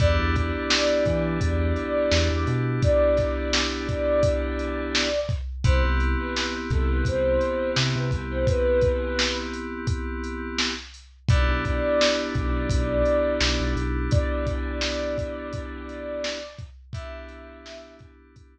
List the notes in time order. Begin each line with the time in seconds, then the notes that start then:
0.00 E2 B3 D4 E4 G4 D5, kick, closed hi-hat
0.19 E2
0.36 kick, closed hi-hat
0.70 snare
1.06 E3, kick, closed hi-hat
1.41 E2, kick, closed hi-hat
1.76 closed hi-hat
2.11 E2, snare
2.31 E2
2.47 B2, closed hi-hat
2.82 D5, kick, closed hi-hat
3.17 kick, snare, closed hi-hat
3.53 snare
3.89 kick, closed hi-hat
4.23 kick, closed hi-hat
4.59 closed hi-hat
4.95 snare
5.29 kick, closed hi-hat
5.64 C2 B3 C4 E4 G4 C5, kick, closed hi-hat
5.84 C2
6.00 closed hi-hat
6.19 B4
6.36 B4, snare
6.70 C2 A4, kick, closed hi-hat
6.90 B4
7.05 C2 C5, kick, closed hi-hat
7.41 closed hi-hat
7.76 C3, snare
7.96 C3 B4
8.11 C2, kick, closed hi-hat
8.31 C5
8.47 B4, kick, closed hi-hat
8.81 kick, closed hi-hat
9.19 snare
9.54 closed hi-hat
9.87 kick, closed hi-hat
10.24 closed hi-hat
10.58 snare
10.94 closed hi-hat
11.29 B1 B3 D4 E4 G4 D5, kick, closed hi-hat
11.49 B1
11.65 kick, closed hi-hat
12.01 snare
12.35 B1, kick, closed hi-hat
12.70 B1, kick, closed hi-hat
13.05 closed hi-hat
13.41 B1, snare
13.60 B1
13.76 B1, closed hi-hat
14.11 D5, kick, closed hi-hat
14.47 kick, closed hi-hat
14.81 snare
15.18 kick, closed hi-hat
15.53 kick, closed hi-hat
15.89 closed hi-hat
16.24 snare
16.58 kick, closed hi-hat
16.93 B3 D4 E4 G4 E5, kick, closed hi-hat
17.29 closed hi-hat
17.66 snare
17.99 kick, closed hi-hat
18.36 kick, closed hi-hat